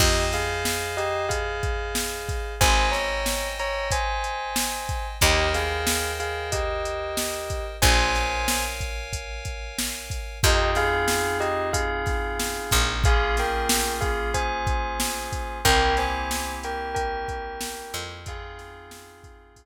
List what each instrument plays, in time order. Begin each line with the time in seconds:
0.00 electric bass (finger) F2, tubular bells G4 D#5, electric piano 2 C5 D#5 F5 G#5, kick, crash
0.32 tubular bells G#4 F5, snare, closed hi-hat
0.65 snare
0.97 tubular bells G4 D#5, closed hi-hat
1.29 tubular bells G#4 F5, kick, closed hi-hat
1.63 kick, closed hi-hat
1.95 snare
2.28 kick, snare, closed hi-hat
2.61 electric bass (finger) G#1, tubular bells C5 G#5, electric piano 2 C5 D#5 G5 G#5, kick, closed hi-hat
2.91 tubular bells C#5 A#5, snare, closed hi-hat
3.26 snare
3.59 tubular bells C#5 A#5, closed hi-hat
3.91 tubular bells C5 G#5, kick, closed hi-hat
4.24 closed hi-hat
4.56 snare
4.89 kick, closed hi-hat
5.21 electric bass (finger) D#2, tubular bells G4 D#5, electric piano 2 A#4 C5 D#5 G5, kick, closed hi-hat
5.54 tubular bells G#4 F5, snare, closed hi-hat
5.87 snare
6.20 tubular bells G#4 F5, closed hi-hat
6.52 tubular bells G4 D#5, kick, closed hi-hat
6.85 closed hi-hat
7.17 snare
7.50 kick, closed hi-hat
7.82 electric bass (finger) A#1, electric piano 2 A#4 C#5 F5 G#5, tubular bells C5 G#5, kick, closed hi-hat
8.15 snare, closed hi-hat
8.48 snare
8.80 kick, closed hi-hat
9.13 kick, closed hi-hat
9.45 kick, closed hi-hat
9.79 snare
10.10 kick, closed hi-hat
10.43 electric bass (finger) F2, electric piano 2 C4 D#4 F4 G#4, tubular bells G4 D#5, kick, closed hi-hat
10.75 tubular bells G#4 F5, snare, closed hi-hat
11.08 snare
11.40 tubular bells G4 D#5, closed hi-hat
11.73 tubular bells G#4 F5, kick, closed hi-hat
12.06 kick, snare, closed hi-hat
12.40 snare
12.71 electric bass (finger) A#1, kick, closed hi-hat
13.04 electric piano 2 A#3 C#4 F4 G#4, tubular bells G#4 F5, kick, closed hi-hat
13.37 tubular bells A#4 G5, snare, closed hi-hat
13.69 snare
14.01 tubular bells G#4 F5, kick, closed hi-hat
14.34 tubular bells C5 G#5, kick, closed hi-hat
14.67 kick, closed hi-hat
15.00 snare
15.32 kick, closed hi-hat
15.65 electric bass (finger) C2, electric piano 2 A#3 C4 E4 G4, tubular bells A#4 G5, kick, closed hi-hat
15.97 tubular bells C5 G#5, snare, closed hi-hat
16.31 snare
16.63 tubular bells A#4 G5, closed hi-hat
16.95 tubular bells A#4 G5, kick, closed hi-hat
17.28 kick, closed hi-hat
17.61 snare
17.93 electric bass (finger) F2, closed hi-hat
18.26 electric piano 2 C4 D#4 F4 G#4, tubular bells G#4 F5, kick, closed hi-hat
18.59 snare, closed hi-hat
18.91 snare
19.24 kick, closed hi-hat
19.56 kick, closed hi-hat